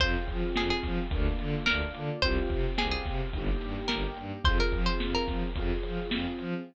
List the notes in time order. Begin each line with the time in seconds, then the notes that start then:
0.00 F2 C4 F4 G#4 C5, kick, closed hi-hat
0.28 F3, kick, closed hi-hat
0.56 F2 G#4, snare
0.70 G#4
0.83 F3, kick, snare, closed hi-hat
1.11 D2 A#3 D4 F4, kick, closed hi-hat
1.39 D3, closed hi-hat
1.66 D2 A#3 D4 F4 A#4, snare
1.94 D3, closed hi-hat
2.22 C2 C4 F4 C5, kick, closed hi-hat
2.26 G4
2.50 C3, kick, closed hi-hat
2.78 C2 G#4, snare
2.91 G#4
3.06 C3, kick, snare, closed hi-hat
3.33 G1 A#3 D#4 G4, kick, closed hi-hat
3.61 G2, closed hi-hat
3.88 G1 A#3 D#4 G4 A#4, snare
4.17 G2, closed hi-hat
4.44 F2 C4 F4 G#4 C5, kick, closed hi-hat
4.60 A#4
4.72 F3, kick, closed hi-hat
4.86 C5
5.00 F2, snare
5.15 A#4
5.28 F3, kick, snare, closed hi-hat
5.56 F2 C4 F4 G#4, kick, closed hi-hat
5.83 F3, closed hi-hat
6.10 F2 C4 F4 G#4, snare
6.39 F3, closed hi-hat